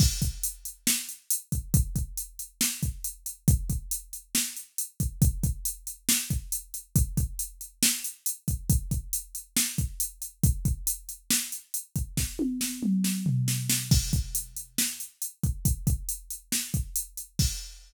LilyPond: \new DrumStaff \drummode { \time 4/4 \tempo 4 = 138 <cymc bd>8 <hh bd>8 hh8 hh8 sn8 hh8 hh8 <hh bd>8 | <hh bd>8 <hh bd>8 hh8 hh8 sn8 <hh bd>8 hh8 hh8 | <hh bd>8 <hh bd>8 hh8 hh8 sn8 hh8 hh8 <hh bd>8 | <hh bd>8 <hh bd>8 hh8 hh8 sn8 <hh bd>8 hh8 hh8 |
<hh bd>8 <hh bd>8 hh8 hh8 sn8 hh8 hh8 <hh bd>8 | <hh bd>8 <hh bd>8 hh8 hh8 sn8 <hh bd>8 hh8 hh8 | <hh bd>8 <hh bd>8 hh8 hh8 sn8 hh8 hh8 <hh bd>8 | <bd sn>8 tommh8 sn8 toml8 sn8 tomfh8 sn8 sn8 |
<cymc bd>8 <hh bd>8 hh8 hh8 sn8 hh8 hh8 <hh bd>8 | <hh bd>8 <hh bd>8 hh8 hh8 sn8 <hh bd>8 hh8 hh8 | <cymc bd>4 r4 r4 r4 | }